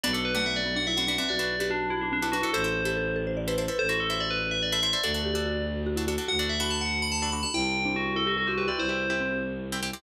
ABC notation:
X:1
M:6/8
L:1/16
Q:3/8=96
K:Bphr
V:1 name="Tubular Bells"
d A B f e d2 f e f f e | d4 D2 E D D D F A | c6 z6 | c F A e d B2 e d e e d |
d6 z6 | f d e b a f2 b a b b a | g4 F2 A F F F B d | c6 z6 |]
V:2 name="Marimba"
B,3 A, B,2 B, D E C D C | F3 G F2 F D C E D E | A3 G A2 A c d B c B | A6 z6 |
A2 G G F4 F E F2 | F8 z4 | E3 D E2 E G A F G F | E4 C4 z4 |]
V:3 name="Pizzicato Strings"
[DFB] [DFB]2 [DFB]6 [DFB] [DFB] [DFB]- | [DFB] [DFB]2 [DFB]6 [DFB] [DFB] [DFB] | [EAc] [EAc]2 [EAc]6 [EAc] [EAc] [EAc]- | [EAc] [EAc]2 [EAc]6 [EAc] [EAc] [EAc] |
[DFA] [DFA]2 [DFA]6 [DFA] [DFA] [DFA]- | [DFA] [DFA]2 [DFA]6 [DFA] [DFA] [DFA] | [CEG] [CEG]2 [CEG]6 [CEG] [CEG] [CEG]- | [CEG] [CEG]2 [CEG]6 [CEG] [CEG] [CEG] |]
V:4 name="Violin" clef=bass
B,,,12 | B,,,12 | A,,,12 | A,,,12 |
D,,12 | D,,12 | C,,12 | C,,12 |]